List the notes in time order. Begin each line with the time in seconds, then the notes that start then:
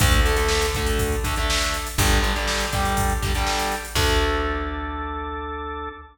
0.00 D2 D3 A3 D4 A4, kick, closed hi-hat
0.11 closed hi-hat
0.25 D3 A3, closed hi-hat
0.36 D3 A3, closed hi-hat
0.48 snare
0.62 closed hi-hat
0.75 D3 A3, kick, closed hi-hat
0.86 closed hi-hat
0.99 D4 A4, kick, closed hi-hat
1.12 closed hi-hat
1.24 D3 A3, kick, closed hi-hat
1.36 D3 A3, closed hi-hat
1.50 snare
1.62 closed hi-hat
1.74 closed hi-hat
1.87 closed hi-hat
1.98 G1 D3 G3 D4 G4, kick, closed hi-hat
2.11 closed hi-hat
2.23 D3 G3, closed hi-hat
2.36 D3 G3, closed hi-hat
2.48 snare
2.60 closed hi-hat
2.73 D3 G3, kick, closed hi-hat
2.85 closed hi-hat
2.97 D4 G4, kick, closed hi-hat
3.10 closed hi-hat
3.22 D3 G3, kick, closed hi-hat
3.35 D3 G3, closed hi-hat
3.47 snare
3.59 closed hi-hat
3.72 closed hi-hat
3.85 closed hi-hat
3.95 D2 D3 A3 D4 A4, kick, crash